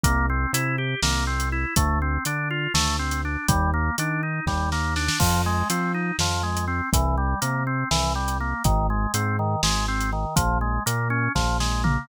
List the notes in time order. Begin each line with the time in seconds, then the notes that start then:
0.04 C2 A#3, kick, closed hi-hat
0.30 C4
0.53 C3 E4, closed hi-hat
0.78 G4
1.02 C2 A#3, snare
1.27 C4
1.40 closed hi-hat
1.52 E4
1.76 D2 A3, kick, closed hi-hat
2.02 C4
2.25 D3 D4, closed hi-hat
2.51 F4
2.74 D2 A3, snare
2.99 C4
3.11 closed hi-hat
3.25 D4
3.48 D#2 G3, kick, closed hi-hat
3.74 A#3
3.98 D#3 D4, closed hi-hat
4.23 D#4
4.46 D#2 G3, kick, snare
4.72 A#3, snare
4.96 D4, snare
5.09 snare
5.20 F2 F3, kick, crash
5.46 G#3
5.70 F3 C4, closed hi-hat
5.94 D#4
6.19 F2 F3, snare
6.43 G#3
6.57 closed hi-hat
6.68 C4
6.93 C2 E3, kick, closed hi-hat
7.18 G3
7.41 C3 A#3, closed hi-hat
7.67 C4
7.91 C2 E3, snare
8.15 G3
8.28 closed hi-hat
8.40 A#3
8.64 G#1 D#3, kick, closed hi-hat
8.90 G#3
9.14 G#2 C4, closed hi-hat
9.39 D#3
9.63 G#1 G#3, snare
9.88 C4
10.01 closed hi-hat
10.13 D#3
10.36 A#1 F3, kick, closed hi-hat
10.61 G#3
10.86 A#2 A#3, closed hi-hat
11.10 C#4
11.35 A#1 F3, kick, snare
11.60 G#3, snare
11.84 A#3, floor tom